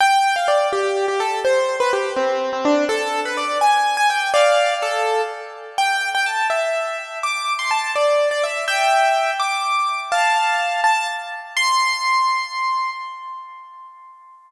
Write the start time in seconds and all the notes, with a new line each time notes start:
0.00 G5
0.36 F5
0.48 D5
0.73 G4
1.08 G4
1.20 A4
1.45 C5
1.80 B4
1.93 G4
2.16 C4
2.53 C4
2.65 D4
2.89 A4
3.25 B4
3.37 D5
3.61 G#5
3.97 G#5
4.10 G5
4.34 D5 F5
4.82 A4
5.78 G5
6.15 G5
6.26 A5
6.50 E5
7.23 D6
7.59 C6
7.71 A5
7.95 D5
8.31 D5
8.43 E5
8.68 E5 G5
9.40 D6
10.12 F5 A5
10.84 A5
11.57 C6